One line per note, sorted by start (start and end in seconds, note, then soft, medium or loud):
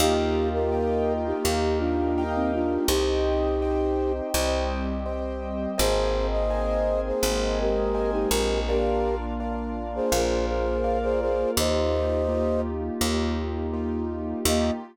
0.00 1.33 D#2 medium
0.00 1.44 A#3 medium
0.00 0.49 D#4 loud
0.00 1.44 D#4 medium
0.00 1.44 F4 medium
0.00 0.49 G4 loud
0.00 1.44 G4 medium
0.00 0.64 A#4 loud
0.00 0.64 D#5 medium
0.00 0.64 F5 loud
0.00 0.64 G5 loud
0.53 1.13 G4 medium
0.53 1.13 A#4 medium
0.72 1.37 A#4 medium
0.72 1.37 D#5 medium
0.72 1.37 F5 medium
0.72 1.37 G5 medium
1.26 1.79 D#4 medium
1.26 1.79 G4 medium
1.44 2.78 D#2 medium
1.44 2.88 A#3 medium
1.44 2.88 D#4 medium
1.44 2.88 G4 medium
1.44 2.09 A#4 loud
1.44 2.88 A#4 medium
1.44 2.09 D#5 medium
1.44 2.09 F5 medium
1.44 2.09 G5 medium
1.78 2.23 D4 medium
1.78 2.23 F4 medium
2.18 2.83 A#4 medium
2.18 2.83 D#5 medium
2.18 2.83 F5 medium
2.18 2.83 G5 medium
2.35 2.52 C4 medium
2.35 2.52 D#4 medium
2.54 2.87 D4 medium
2.54 2.87 F4 medium
2.88 4.21 C2 loud
2.88 4.33 C4 medium
2.88 4.12 D#4 loud
2.88 4.34 D#4 medium
2.88 4.12 G4 loud
2.88 4.33 G4 medium
2.88 3.54 C5 medium
2.88 3.54 D#5 loud
2.88 3.54 G5 medium
3.62 4.27 C5 medium
3.62 4.27 D#5 medium
3.62 4.27 G5 medium
4.34 5.67 C2 medium
4.34 5.77 G3 medium
4.34 5.77 C4 medium
4.34 5.77 G4 medium
4.34 4.99 C5 medium
4.34 4.99 D#5 medium
4.34 4.99 G5 medium
5.06 5.71 C5 medium
5.06 5.71 D#5 medium
5.06 5.71 G5 medium
5.78 7.12 G#1 loud
5.78 7.21 A#3 medium
5.78 7.21 C4 medium
5.78 7.21 D#4 medium
5.78 7.21 G#4 medium
5.78 6.27 G#4 loud
5.78 6.43 A#4 loud
5.78 6.43 C5 loud
5.78 6.27 C5 loud
5.78 6.43 D#5 loud
5.78 6.43 G#5 medium
6.32 7.01 C5 medium
6.32 7.01 D#5 medium
6.50 7.15 A#4 medium
6.50 7.15 C5 medium
6.50 7.15 D#5 medium
6.50 7.15 G#5 medium
7.06 7.59 G#4 medium
7.06 7.59 C5 medium
7.23 8.26 G#1 medium
7.23 8.67 G#3 medium
7.23 8.67 A#3 medium
7.23 8.67 C4 medium
7.23 8.67 G#4 medium
7.23 7.89 A#4 medium
7.23 7.89 C5 medium
7.23 7.89 D#5 medium
7.23 7.89 G#5 medium
7.61 8.11 G4 medium
7.61 8.11 A#4 medium
7.94 8.59 A#4 medium
7.94 8.59 C5 medium
7.94 8.59 D#5 medium
7.94 8.59 G#5 medium
8.12 8.29 D#4 medium
8.12 8.29 G4 medium
8.31 10.00 A#1 loud
8.31 8.60 G4 medium
8.31 8.60 A#4 medium
8.68 10.11 A#3 medium
8.68 10.11 D4 medium
8.68 10.11 F4 medium
8.68 9.15 G4 medium
8.68 9.33 A#4 loud
8.68 9.15 A#4 loud
8.68 9.33 D5 medium
8.68 9.33 F5 loud
9.40 10.05 A#4 medium
9.40 10.05 D5 medium
9.40 10.05 F5 medium
9.95 10.46 G#4 medium
9.95 10.46 C5 medium
10.12 11.45 A#1 medium
10.12 11.55 A#3 medium
10.12 11.55 F4 medium
10.12 10.77 A#4 medium
10.12 11.56 A#4 medium
10.12 10.77 D5 medium
10.12 10.77 F5 medium
10.47 10.98 G#4 medium
10.47 10.98 C5 medium
10.84 11.49 A#4 medium
10.84 11.49 D5 medium
10.84 11.49 F5 medium
11.03 11.20 G#4 medium
11.03 11.20 C5 loud
11.21 11.51 G#4 medium
11.21 11.51 C5 loud
11.56 12.90 D#2 loud
11.56 14.42 A#3 medium
11.56 12.22 A#3 medium
11.56 14.42 D#4 medium
11.56 12.22 D#4 loud
11.56 14.42 F4 medium
11.56 12.22 F4 medium
11.56 14.42 G4 medium
11.56 12.22 G4 loud
11.56 12.61 C5 medium
11.56 12.61 D#5 loud
12.29 12.94 A#3 medium
12.29 12.94 D#4 medium
12.29 12.94 F4 medium
12.29 12.94 G4 medium
13.01 14.34 D#2 medium
13.01 13.66 A#3 loud
13.01 13.66 D#4 medium
13.01 13.66 F4 medium
13.01 13.66 G4 medium
13.73 14.39 A#3 medium
13.73 14.39 D#4 medium
13.73 14.39 F4 medium
13.73 14.39 G4 medium
14.45 14.71 D#2 loud
14.45 14.70 A#3 loud
14.45 14.71 A#3 loud
14.45 14.70 D#4 loud
14.45 14.71 D#4 medium
14.45 14.70 F4 medium
14.45 14.71 F4 medium
14.45 14.70 G4 loud
14.45 14.71 G4 loud
14.45 14.72 D#5 loud